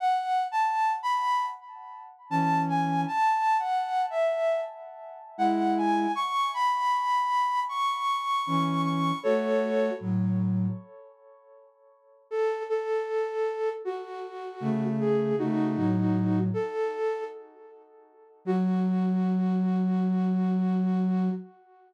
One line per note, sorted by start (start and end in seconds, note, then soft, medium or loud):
0.00 0.44 F#5 medium
0.51 0.93 A5 medium
1.03 1.45 B5 loud
2.30 3.05 E3 medium
2.30 3.05 C#4 medium
2.30 2.62 A5 medium
2.69 3.01 G#5 medium
3.08 3.57 A5 loud
3.59 4.02 F#5 medium
4.10 4.60 E5 medium
5.38 6.07 G#3 medium
5.38 6.07 E4 medium
5.38 5.75 F#5 medium
5.77 6.12 G#5 medium
6.15 6.51 C#6 loud
6.54 7.60 B5 loud
7.69 8.81 C#6 medium
8.47 9.12 E3 medium
8.47 9.12 C#4 medium
8.85 9.19 C#6 medium
9.23 9.90 A3 loud
9.23 9.90 F#4 loud
9.23 9.93 A4 medium
9.23 9.93 C#5 loud
10.00 10.67 A2 medium
10.00 10.67 F#3 medium
12.31 12.63 A4 loud
12.70 13.69 A4 loud
13.85 14.84 F#4 medium
14.60 15.34 C#3 medium
14.60 15.34 A3 loud
15.00 15.35 G#4 medium
15.39 15.76 C#3 medium
15.39 15.76 A3 loud
15.39 16.39 D#4 medium
15.39 16.39 F#4 medium
15.76 16.49 A2 medium
15.76 16.49 F#3 medium
16.54 17.24 A4 loud
18.45 21.29 F#3 loud
18.45 21.31 F#4 loud